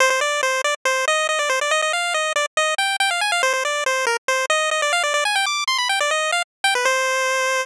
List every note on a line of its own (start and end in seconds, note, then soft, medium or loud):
0.00 0.10 C5 loud
0.10 0.20 C5 medium
0.21 0.41 D5 medium
0.43 0.62 C5 medium
0.64 0.75 D5 medium
0.85 1.05 C5 medium
1.08 1.27 D#5 loud
1.29 1.39 D#5 medium
1.39 1.49 D5 medium
1.49 1.60 C5 medium
1.61 1.71 D5 medium
1.71 1.81 D#5 loud
1.82 1.92 D#5 medium
1.93 2.14 F5 medium
2.14 2.33 D#5 medium
2.36 2.46 D5 medium
2.57 2.75 D#5 medium
2.78 2.96 G5 medium
3.00 3.10 G5 loud
3.11 3.21 F5 medium
3.21 3.31 G#5 medium
3.32 3.42 F5 medium
3.43 3.53 C5 loud
3.53 3.64 C5 medium
3.65 3.84 D5 medium
3.86 4.05 C5 medium
4.07 4.17 A#4 medium
4.28 4.46 C5 medium
4.50 4.70 D#5 loud
4.71 4.81 D#5 medium
4.82 4.92 D5 medium
4.93 5.03 F5 loud
5.03 5.13 D5 medium
5.14 5.24 D5 loud
5.25 5.35 G#5 medium
5.36 5.46 G5 loud
5.46 5.64 D6 medium
5.67 5.78 C6 medium
5.78 5.88 B5 medium
5.89 5.99 G5 medium
6.00 6.11 D5 medium
6.11 6.31 D#5 medium
6.32 6.42 F5 medium
6.64 6.74 G5 medium
6.75 6.85 B4 medium
6.85 7.65 C5 loud